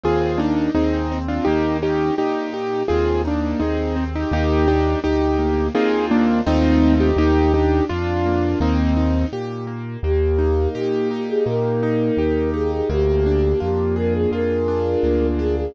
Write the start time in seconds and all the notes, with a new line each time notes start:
0.04 D#2 C4 F4 G#4
0.38 A#3 D4 D#4
0.75 D#2 C4 D#4 G#4
1.12 C4
1.28 D4 F4
1.45 D#2 A#3 D#4 G4
1.82 C#4 D#4 G4
2.18 A#2 D#4 G4
2.54 G4
2.88 D#2 C4 F4 G#4
3.25 A#3 D4 D#4
3.60 D#2 C4 D#4 G#4
3.96 C4
4.15 D#4 G4
4.31 D#2 A#3 D#4 G4
4.68 D4 D#4 G4
5.04 D2 D#4 G4
5.39 A#3
5.75 D#2 A#3 C4 D#4 F4 G#4
6.11 A#3 D4
6.46 D#2 A3 C4 D#4 F4
7.00 D#4 G4
7.17 D#2 A#3 D#4 G4
7.54 D4 D#4 G4
7.89 F2 D4 F4
8.26 A#3
8.60 D#2 A#3 C4 D#4
8.97 D#4
9.33 A#2 G4
9.67 A#3
10.03 D#2 A#3 G4
10.39 D#4
10.75 A#2 G4
11.11 D#4 G4
11.28 G#4
11.46 A#2 A#3 A#4
11.83 D#4
12.17 D#2 G4
12.54 D#4 G#4
12.72 G#4
12.89 D2 A#3 G4
13.26 D4
13.60 F2 F4 G4
13.96 G#4 A#4
14.14 G#4
14.31 F2 F4 A#4
14.68 D4
15.03 D2 A#3
15.39 D4 G#4
15.57 G#4